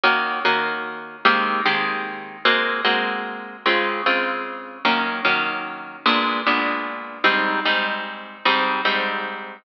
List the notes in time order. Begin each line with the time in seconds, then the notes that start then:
0.04 D#3 A#3 C#4 F#4
0.45 D#3 A#3 C#4 F#4
1.25 D#3 G#3 A#3 C4 G4
1.66 D#3 G#3 A#3 C4 G4
2.45 G#3 A#3 C4 F#4
2.85 G#3 A#3 C4 F#4
3.66 C#3 G#3 C4 F4
4.06 C#3 G#3 C4 F4
4.85 D#3 F#3 A#3 C#4
5.25 D#3 F#3 A#3 C#4
6.06 A#2 G#3 B3 D4
6.47 A#2 G#3 B3 D4
7.24 G#2 G3 C4 D#4
7.65 G#2 G3 C4 D#4
8.45 G#2 G3 C4 D#4
8.85 G#2 G3 C4 D#4